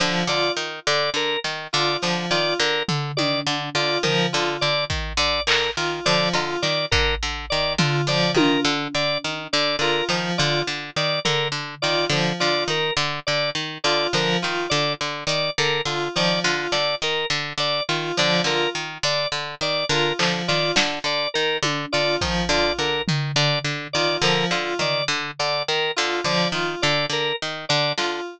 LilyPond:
<<
  \new Staff \with { instrumentName = "Pizzicato Strings" } { \clef bass \time 7/8 \tempo 4 = 104 d8 d8 dis8 d8 d8 dis8 d8 | d8 dis8 d8 d8 dis8 d8 d8 | dis8 d8 d8 dis8 d8 d8 dis8 | d8 d8 dis8 d8 d8 dis8 d8 |
d8 dis8 d8 d8 dis8 d8 d8 | dis8 d8 d8 dis8 d8 d8 dis8 | d8 d8 dis8 d8 d8 dis8 d8 | d8 dis8 d8 d8 dis8 d8 d8 |
dis8 d8 d8 dis8 d8 d8 dis8 | d8 d8 dis8 d8 d8 dis8 d8 | d8 dis8 d8 d8 dis8 d8 d8 | dis8 d8 d8 dis8 d8 d8 dis8 |
d8 d8 dis8 d8 d8 dis8 d8 | d8 dis8 d8 d8 dis8 d8 d8 | }
  \new Staff \with { instrumentName = "Electric Piano 2" } { \time 7/8 f8 f'8 r2 f'8 | f8 f'8 r2 f'8 | f8 f'8 r2 f'8 | f8 f'8 r2 f'8 |
f8 f'8 r2 f'8 | f8 f'8 r2 f'8 | f8 f'8 r2 f'8 | f8 f'8 r2 f'8 |
f8 f'8 r2 f'8 | f8 f'8 r2 f'8 | f8 f'8 r2 f'8 | f8 f'8 r2 f'8 |
f8 f'8 r2 f'8 | f8 f'8 r2 f'8 | }
  \new Staff \with { instrumentName = "Drawbar Organ" } { \time 7/8 r8 d''8 r8 d''8 ais'8 r8 d''8 | r8 d''8 ais'8 r8 d''8 r8 d''8 | ais'8 r8 d''8 r8 d''8 ais'8 r8 | d''8 r8 d''8 ais'8 r8 d''8 r8 |
d''8 ais'8 r8 d''8 r8 d''8 ais'8 | r8 d''8 r8 d''8 ais'8 r8 d''8 | r8 d''8 ais'8 r8 d''8 r8 d''8 | ais'8 r8 d''8 r8 d''8 ais'8 r8 |
d''8 r8 d''8 ais'8 r8 d''8 r8 | d''8 ais'8 r8 d''8 r8 d''8 ais'8 | r8 d''8 r8 d''8 ais'8 r8 d''8 | r8 d''8 ais'8 r8 d''8 r8 d''8 |
ais'8 r8 d''8 r8 d''8 ais'8 r8 | d''8 r8 d''8 ais'8 r8 d''8 r8 | }
  \new DrumStaff \with { instrumentName = "Drums" } \drummode { \time 7/8 r8 cb8 r4 r8 sn4 | hh4 r8 tomfh8 tommh4. | tomfh4 r8 bd8 r8 hc4 | r8 cb8 sn8 bd8 r4 tomfh8 |
r8 tommh8 r4 r4. | hc4 r4 tomfh4. | r8 sn8 r4 r4. | r8 sn8 r4 hh4. |
r8 hh8 sn4 r4. | hh8 sn8 r8 hh8 r4. | hc4 sn4 r8 tommh4 | bd4 r8 tomfh8 r4. |
r4 tomfh4 r4. | hh4 r4 r4 sn8 | }
>>